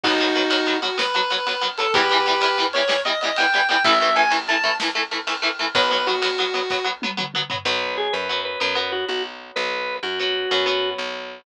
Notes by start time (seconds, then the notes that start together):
0.04 B1 F#3 B3 D#4 F#4, kick, crash
0.19 F#3 B3, ride
0.35 F#3 B3, ride
0.50 F#3 B3, ride
0.67 F#3 B3, ride
0.82 F#3 B3 F#4, ride
0.98 F#3 B3 B4, snare
1.14 F#3 B3, ride
1.30 F#3 B3, ride
1.47 F#3 B3, ride
1.61 F#3 B3, ride
1.78 F#3 B3 A4, ride
1.94 E2 E3 G3 B3 G4 B4, kick, ride
2.10 E3 G3 B3, ride
2.26 E3 G3 B3, ride
2.41 E3 G3 B3, ride
2.57 E3 G3 B3, ride
2.73 E3 G3 B3 C#5, ride
2.88 E3 G3 B3, snare
3.05 E3 G3 B3 D#5, ride
3.21 E3 G3 B3 D#5, ride
3.36 E3 G3 B3 G5, ride
3.53 E3 G3 B3, ride
3.69 E3 G3 B3 G5, ride
3.84 A1 E3 A3 E5, kick, ride
4.01 E3 A3 E5, ride
4.16 E3 A3 G#5, ride
4.30 E3 A3, ride
4.48 E3 A3 A5, ride
4.64 E3 A3, ride
4.80 E3 A3, snare
4.95 E3 A3, ride
5.11 E3 A3, ride
5.27 E3 A3, ride
5.42 E3 A3, ride
5.59 E3 A3, ride
5.75 B1 F#3 B3 B4, kick, ride
5.90 F#3 B3 B4, ride
6.07 F#3 B3 F#4, ride
6.22 F#3 B3, ride
6.38 F#3 B3, ride
6.54 F#3 B3, ride
6.70 F#3 B3, kick, snare
6.84 F#3 B3
7.02 F#3 B3, high tom
7.17 F#3 B3, mid tom
7.34 F#3 B3, mid tom
7.50 F#3 B3, floor tom
7.65 B1 F#3 B3 B4
7.97 G#4
8.13 F#2 B4
8.29 F#3 B3
8.45 B4
8.60 F#2 F#3 B3 B4
8.75 F#3 B3 B4
8.92 F#4
9.09 B1 F#4
9.56 B1 B4
10.03 F#2 F#4
10.19 F#3 B3
10.51 F#2 F#3 B3
10.66 F#3 B3
10.98 B1